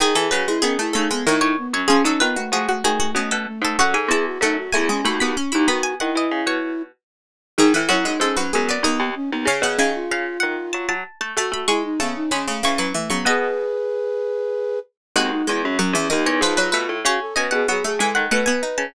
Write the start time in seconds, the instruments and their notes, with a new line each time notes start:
0.00 harpsichord D#3, pizzicato strings D#3 G#4, flute G#4
0.15 harpsichord E3, pizzicato strings E3 A4, flute G#4
0.31 pizzicato strings C#3 B4, harpsichord F#3, flute F#4
0.47 harpsichord G#3, flute E4
0.62 pizzicato strings D#3 G#4, harpsichord B3, flute C#4
0.79 harpsichord A3, flute E4
0.93 pizzicato strings C#3 A4, harpsichord A3, flute D#4
1.11 harpsichord G#3, flute B3
1.26 pizzicato strings A2 C#5, harpsichord D#3, flute D#4
1.41 pizzicato strings A2 C#5
1.58 flute B3
1.73 pizzicato strings F#2 C#5, flute C#4
1.88 pizzicato strings F3 G#4, flute C#4, harpsichord C#4
2.04 pizzicato strings F#3 A4, flute C#4, harpsichord D#4
2.20 pizzicato strings D#3 B4, flute B3, harpsichord F4
2.36 flute A3, harpsichord F#4
2.52 pizzicato strings F3 G#4, flute A3, harpsichord F#4
2.69 flute A3, harpsichord F#4
2.84 pizzicato strings D#3 G#4, flute A3, harpsichord F#4
3.00 flute A3, harpsichord F#4
3.15 pizzicato strings B2 D#5, flute A3, harpsichord C#4
3.31 pizzicato strings B2 A4
3.47 flute A3
3.62 pizzicato strings G#2 A4, flute A3
3.79 pizzicato strings F#2 F#5, harpsichord F#4, flute A4
3.94 pizzicato strings G#2 G#5, flute A4
4.08 pizzicato strings E2 A5, harpsichord E4, flute G#4
4.26 flute F#4
4.41 pizzicato strings F#2 F#5, harpsichord A3, flute D#4
4.58 flute F#4
4.73 pizzicato strings E2 G#5, harpsichord A3, flute E4
4.89 harpsichord G#3, flute C#4
5.05 pizzicato strings D#2 B5, harpsichord A3, flute F#4
5.20 pizzicato strings D#2 B5, harpsichord B3
5.37 flute C#4, harpsichord C#4
5.52 pizzicato strings D#2 B5, flute D#4, harpsichord E4
5.68 pizzicato strings D#3 B5, harpsichord B3, flute F#4
5.83 pizzicato strings G#5
6.00 pizzicato strings D#3 F#5, flute E4
6.15 pizzicato strings E3 D#5
6.31 pizzicato strings C#3
6.46 pizzicato strings B2 C#5
7.58 pizzicato strings G#2 G#4, harpsichord D#3, flute D#4
7.74 pizzicato strings A2, harpsichord E3, flute E4
7.89 pizzicato strings F#2 F#4, harpsichord F#3, flute E4
8.05 harpsichord G#3, flute D#4
8.20 pizzicato strings G#2 A4, harpsichord G#3, flute C#4
8.37 harpsichord F#3, flute C#4, pizzicato strings B4
8.53 pizzicato strings F#2, harpsichord G#3, flute B3
8.69 harpsichord B3, pizzicato strings D5
8.83 pizzicato strings D#2 D#5, harpsichord D#3, flute B3
9.00 pizzicato strings D#2
9.16 flute C#4
9.32 pizzicato strings D#2, flute B3
9.45 pizzicato strings C#3 F5, harpsichord C#3, flute G#4
9.62 pizzicato strings B2 F#5, harpsichord C#3
9.79 harpsichord C#3, pizzicato strings D#3 G#5
9.95 flute F4
10.11 pizzicato strings C#3 F5
10.40 pizzicato strings D#3 F#5
10.73 pizzicato strings F#3 A5
10.89 pizzicato strings F#3 A5
11.21 pizzicato strings A3 A5
11.37 pizzicato strings A3 A5, harpsichord A3, flute F#4
11.52 pizzicato strings A3 B5, flute F#4
11.68 harpsichord G#3, pizzicato strings G#3 C#6, flute E4
11.84 flute D#4
12.00 harpsichord C#3, pizzicato strings A3 A5, flute B3
12.16 flute D#4
12.31 harpsichord C#3, pizzicato strings G#3 B5, flute C#4
12.48 harpsichord C#3, flute A3
12.63 harpsichord C#3, pizzicato strings E3 C#6, flute C#4
12.78 pizzicato strings E3 C#6, harpsichord F#3
12.94 harpsichord E3, flute A3
13.10 pizzicato strings C#3 C#6, harpsichord F#3, flute B3
13.25 pizzicato strings B2 D#5, harpsichord B3, flute G#4 B4
15.16 pizzicato strings D#2 F#4, harpsichord G#3, flute C4
15.31 flute D#4
15.47 pizzicato strings E2, harpsichord G#3, flute E4
15.63 pizzicato strings F#2, flute C#4
15.79 pizzicato strings F#2 F#5, harpsichord F#3, flute C#4
15.93 pizzicato strings E2, harpsichord E3, flute C#4
16.10 pizzicato strings D#2 D#5, harpsichord D#3, flute D#4
16.26 pizzicato strings E2 C#5
16.41 pizzicato strings G#2 B4, harpsichord F3, flute F4
16.57 harpsichord F#3, pizzicato strings B4
16.72 pizzicato strings B2 B4, harpsichord A3
16.89 pizzicato strings A2
17.05 pizzicato strings C#3 C#5, harpsichord C#4, flute F#4
17.21 flute A4
17.36 pizzicato strings B2 D#5, harpsichord C#4, flute B4
17.51 pizzicato strings B2 F#5, flute G#4
17.68 pizzicato strings F#3, harpsichord B3, flute G#4
17.84 harpsichord A3, flute G#4
17.99 pizzicato strings E3 G#5, harpsichord G#3, flute A4
18.15 pizzicato strings D#3 F#5
18.31 pizzicato strings B2 F#5, harpsichord A3, flute B4
18.46 harpsichord B3, pizzicato strings G#5
18.63 harpsichord D#4
18.78 pizzicato strings C#3 A5